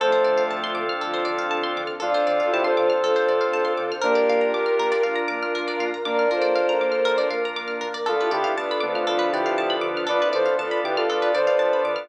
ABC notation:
X:1
M:4/4
L:1/16
Q:1/4=119
K:Dm
V:1 name="Lead 2 (sawtooth)"
[Ac]4 z12 | [DF]4 [EG] [Ac]9 z2 | [B,D]4 z12 | [B,D]2 [DF]4 z10 |
[FA]2 [EG]2 z2 [=B,D] [DF]3 [EG]4 z2 | [=Bd]2 [Ac]2 z2 [EG] [FA]3 [Ac]4 z2 |]
V:2 name="Violin"
[F,A,]8 [D,F,]8 | [DF]8 [FA]8 | [GB]8 [DF]8 | [Bd]2 [Ac]8 z6 |
[DF] [EG] [EG] z [=B,D]2 [A,C]2 [D,F,]8 | [DF] [CE] [CE] z [FA]2 [G=B]2 [Bd]8 |]
V:3 name="Drawbar Organ"
[CDFA]16 | [CDFA]16 | [DFB]16 | [DFB]16 |
[=B,DFA]4 [B,DFA]4 [B,DFA]4 [B,DFA]4 | [=B,DFA]4 [B,DFA]4 [B,DFA]4 [B,DFA]4 |]
V:4 name="Pizzicato Strings"
A c d f a c' d' f' A c d f a c' d' f' | A c d f a c' d' f' A c d f a c' d' f' | B d f b d' f' B d f b d' f' B d f b | d' f' B d f b d' f' B d f b d' f' B d |
A =B d f a =b d' f' A B d f a b d' f' | A =B d f a =b d' f' A B d f a b d' f' |]
V:5 name="Synth Bass 1" clef=bass
D,,2 D,2 D,,2 D,2 D,,2 D,2 D,,2 D,2 | D,,2 D,2 D,,2 D,2 D,,2 D,2 D,,2 D,2 | B,,,2 B,,2 B,,,2 B,,2 B,,,2 B,,2 B,,,2 B,,2 | B,,,2 B,,2 B,,,2 B,,2 B,,,2 B,,2 B,,,2 B,,2 |
D,,2 D,2 D,,2 D,2 D,,2 D,2 D,,2 D,2 | D,,2 D,2 D,,2 D,2 D,,2 D,2 D,,2 D,2 |]
V:6 name="Pad 2 (warm)"
[CDFA]16 | [CDAc]16 | [DFB]16 | [B,DB]16 |
[DFA=B]16 | [DF=Bd]16 |]